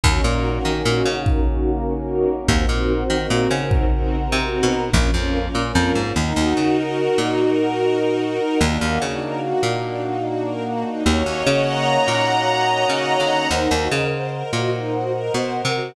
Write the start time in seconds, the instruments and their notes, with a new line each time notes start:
0.03 electric bass (finger) D#2, brass section A#3 C#4 D#4 F#4, string ensemble 1 C#4 D#4 F#4 A#4, kick
0.24 electric bass (finger) A#2, string ensemble 1 C#4 D#4 F#4 A#4
0.55 string ensemble 1 C#4 D#4 F#4 A#4
0.65 electric bass (finger) D#3
0.75 string ensemble 1 C#4 D#4 F#4 A#4
0.85 electric bass (finger) A#2
1.06 electric bass (finger) C#3
1.16 string ensemble 1 C#4 D#4 F#4 A#4
1.26 brass section A#3 C#4 F#4 A#4, kick
1.46 string ensemble 1 C#4 D#4 F#4 A#4
1.77 string ensemble 1 C#4 D#4 F#4 A#4
1.98 string ensemble 1 C#4 D#4 F#4 A#4
2.38 string ensemble 1 C#4 D#4 F#4 A#4
2.48 electric bass (finger) D#2, string ensemble 1 C4 D#4 F#4 A#4, brass section A#4 C5 D#5 F#5, kick
2.69 electric bass (finger) A#2, string ensemble 1 C4 D#4 F#4 A#4
3.00 string ensemble 1 C4 D#4 F#4 A#4
3.10 electric bass (finger) D#3
3.19 string ensemble 1 C4 D#4 F#4 A#4
3.30 electric bass (finger) A#2
3.51 electric bass (finger) C#3
3.60 string ensemble 1 C4 D#4 F#4 A#4
3.71 brass section A#4 C5 F#5 A#5, kick
3.91 string ensemble 1 C4 D#4 F#4 A#4
4.22 string ensemble 1 C4 D#4 F#4 A#4
4.32 electric bass (finger) C3
4.42 string ensemble 1 C4 D#4 F#4 A#4
4.63 electric bass (finger) B2
4.83 string ensemble 1 C4 D#4 F#4 A#4
4.93 electric bass (finger) A#1, brass section A#3 C#4 F4, string ensemble 1 C#4 F4 A#4, kick
5.14 electric bass (finger) F2, string ensemble 1 C#4 F4 A#4
5.45 string ensemble 1 C#4 F4 A#4
5.55 electric bass (finger) A#2
5.64 string ensemble 1 C#4 F4 A#4
5.75 electric bass (finger) F2
5.95 electric bass (finger) G#2
6.05 string ensemble 1 C#4 F4 A#4
6.16 electric bass (finger) D#2, string ensemble 1 D#4, brass section A#4 D#5 F#5
6.36 electric bass (finger) D#2, string ensemble 1 F#4
6.57 electric bass (finger) C#3, string ensemble 1 A#4
6.77 string ensemble 1 F#4
6.98 string ensemble 1 D#4
7.18 electric bass (finger) A#2, string ensemble 1 F#4
7.38 string ensemble 1 A#4
7.59 string ensemble 1 F#4
7.79 string ensemble 1 D#4
7.99 string ensemble 1 F#4
8.20 string ensemble 1 A#4
8.40 string ensemble 1 F#4
8.61 electric bass (finger) D#2, brass section A#3 D4 D#4 F#4, string ensemble 1 D4
8.81 electric bass (finger) D#2, string ensemble 1 D#4
9.02 electric bass (finger) C#3, string ensemble 1 F#4
9.22 string ensemble 1 A#4
9.42 string ensemble 1 F#4
9.63 electric bass (finger) A#2, string ensemble 1 D#4
9.84 string ensemble 1 D4
10.03 string ensemble 1 D#4
10.24 string ensemble 1 F#4
10.45 string ensemble 1 A#4
10.65 string ensemble 1 F#4
10.85 string ensemble 1 D#4
11.06 electric bass (finger) D#2, brass section A#3 C#4 D#4 F#4, string ensemble 1 C#5
11.26 electric bass (finger) D#2, string ensemble 1 D#5
11.46 electric bass (finger) C#3, string ensemble 1 F#5
11.67 string ensemble 1 A#5
11.87 string ensemble 1 F#5
12.08 electric bass (finger) A#2, string ensemble 1 D#5
12.28 string ensemble 1 C#5
12.48 string ensemble 1 D#5
12.69 string ensemble 1 F#5
12.89 electric bass (finger) C#3, string ensemble 1 A#5
13.10 string ensemble 1 F#5
13.20 electric bass (finger) D3
13.30 string ensemble 1 D#5
13.51 electric bass (finger) D#2, string ensemble 1 D#4, brass section A#4 C5 D#5 F#5
13.71 electric bass (finger) D#2, string ensemble 1 F#4
13.91 electric bass (finger) C#3, string ensemble 1 A#4
14.12 string ensemble 1 C5
14.32 string ensemble 1 A#4
14.53 electric bass (finger) A#2, string ensemble 1 F#4
14.73 string ensemble 1 D#4
14.93 string ensemble 1 F#4
15.14 string ensemble 1 A#4
15.34 electric bass (finger) B2, string ensemble 1 C5
15.55 string ensemble 1 A#4
15.65 electric bass (finger) C3
15.75 string ensemble 1 F#4